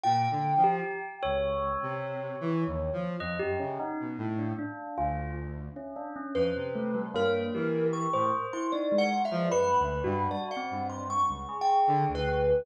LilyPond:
<<
  \new Staff \with { instrumentName = "Kalimba" } { \time 4/4 \tempo 4 = 76 g''4 r2. | r1 | b'4 bes'4 des'''8. c'''16 \tuplet 3/2 { d''8 ges''8 e''8 } | b''4 d''16 ges''8 c'''16 \tuplet 3/2 { des'''4 g''4 b'4 } | }
  \new Staff \with { instrumentName = "Lead 1 (square)" } { \clef bass \time 4/4 \tuplet 3/2 { bes,8 d8 f8 } r8 des,8. c8. \tuplet 3/2 { e8 ees,8 f8 } | f,16 ges,16 des16 r16 b,16 a,8 r8 d,4 r8. | f,16 c8. g,8 e8. a,16 r4 r16 f16 | \tuplet 3/2 { ges,8 d,8 g,8 } r8 g,8. des,16 r8 d16 d,8. | }
  \new Staff \with { instrumentName = "Tubular Bells" } { \time 4/4 f'16 r8 g'8 r16 des''2~ des''8 | ees''16 g'16 des'16 ees'16 r8 d'16 d'8 f'8 r8 des'16 d'16 des'16 | c''8 a16 g16 bes8 g'8. c''8 e'16 ees'16 aes16 r16 aes16 | \tuplet 3/2 { b'4 ges'4 c'4 } r8 aes'4. | }
>>